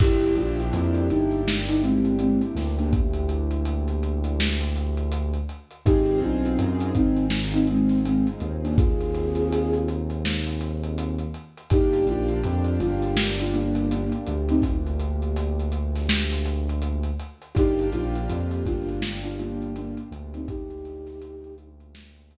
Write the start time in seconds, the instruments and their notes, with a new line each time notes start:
0.00 synth bass 2 G1, acoustic grand piano A#3 D4 E4 G4, flute E4 G4, kick, crash
0.22 closed hi-hat
0.36 synth bass 2 A#1, flute D4 F4, closed hi-hat
0.60 closed hi-hat
0.73 synth bass 2 F2, closed hi-hat
0.95 closed hi-hat
1.10 synth bass 2 G1, flute D#4, closed hi-hat
1.31 closed hi-hat
1.48 snare
1.68 flute D#4, closed hi-hat
1.82 flute G#3 C4, closed hi-hat
2.05 closed hi-hat
2.19 flute G#3 C4, closed hi-hat
2.41 closed hi-hat
2.55 synth bass 2 D2, snare, closed hi-hat
2.78 flute A#3 D4, closed hi-hat
2.93 kick, closed hi-hat
3.13 closed hi-hat
3.29 closed hi-hat
3.51 closed hi-hat
3.65 closed hi-hat
3.88 closed hi-hat
4.03 closed hi-hat
4.24 closed hi-hat
4.40 snare
4.61 closed hi-hat
4.76 closed hi-hat
4.97 closed hi-hat
5.12 closed hi-hat
5.34 closed hi-hat
5.49 closed hi-hat
5.71 closed hi-hat
5.86 synth bass 2 G#1, acoustic grand piano C4 D#4 F4 G#4, flute D#4 G4, kick, closed hi-hat
6.06 closed hi-hat
6.22 synth bass 2 B1, flute D4 F4, closed hi-hat
6.45 closed hi-hat
6.58 synth bass 2 F#2, closed hi-hat
6.80 closed hi-hat
6.95 synth bass 2 G#1, flute C4 D#4, kick, closed hi-hat
7.17 closed hi-hat
7.30 snare
7.53 flute C4 D#4, closed hi-hat
7.67 flute G#3 C4, closed hi-hat
7.89 snare, closed hi-hat
8.05 flute G#3 C4, closed hi-hat
8.27 closed hi-hat
8.40 synth bass 2 D#2, closed hi-hat
8.63 flute A#3 D4, closed hi-hat
8.77 flute F4 G#4, kick, closed hi-hat
9.00 closed hi-hat
9.14 closed hi-hat
9.35 closed hi-hat
9.52 closed hi-hat
9.73 closed hi-hat
9.88 closed hi-hat
10.10 closed hi-hat
10.25 snare
10.47 closed hi-hat
10.61 closed hi-hat
10.84 closed hi-hat
10.98 closed hi-hat
11.19 closed hi-hat
11.34 closed hi-hat
11.57 closed hi-hat
11.70 synth bass 2 G1, acoustic grand piano A#3 D4 F4 G4, flute D#4 G4, kick, closed hi-hat
11.93 closed hi-hat
12.06 synth bass 2 A#1, flute D4 F4, closed hi-hat
12.29 closed hi-hat
12.43 synth bass 2 F2, closed hi-hat
12.64 closed hi-hat
12.80 synth bass 2 G1, flute D4 F4, closed hi-hat
13.02 closed hi-hat
13.17 snare
13.39 flute D4 F4, closed hi-hat
13.53 flute A#3 D4, closed hi-hat
13.75 closed hi-hat
13.91 flute A#3 D4, closed hi-hat
14.12 closed hi-hat
14.27 synth bass 2 D2, closed hi-hat
14.49 flute C4 D#4, closed hi-hat
14.62 kick, closed hi-hat
14.86 closed hi-hat
15.00 closed hi-hat
15.22 closed hi-hat
15.36 closed hi-hat
15.60 closed hi-hat
15.72 closed hi-hat
15.96 snare, closed hi-hat
16.09 snare
16.32 closed hi-hat
16.45 closed hi-hat
16.69 closed hi-hat
16.82 closed hi-hat
17.03 closed hi-hat
17.20 closed hi-hat
17.42 closed hi-hat
17.55 synth bass 2 G1, acoustic grand piano A#3 D4 F4 G4, flute D#4 G4, kick, closed hi-hat
17.79 closed hi-hat
17.93 synth bass 2 A#1, flute D4 F4, closed hi-hat
18.15 closed hi-hat
18.29 synth bass 2 F2, closed hi-hat
18.51 closed hi-hat
18.65 synth bass 2 G1, flute D4 F4, kick, closed hi-hat
18.89 closed hi-hat
19.02 snare
19.23 flute D4 F4, closed hi-hat
19.39 flute A#3 D4, closed hi-hat
19.62 closed hi-hat
19.76 flute A#3 D4, closed hi-hat
19.97 closed hi-hat
20.11 synth bass 2 D2, closed hi-hat
20.34 flute C4 D#4, closed hi-hat
20.48 flute D#4 G4, kick, closed hi-hat
20.70 closed hi-hat
20.85 closed hi-hat
21.07 snare, closed hi-hat
21.22 closed hi-hat
21.44 closed hi-hat
21.58 closed hi-hat
21.80 closed hi-hat
21.95 snare
22.16 closed hi-hat
22.31 closed hi-hat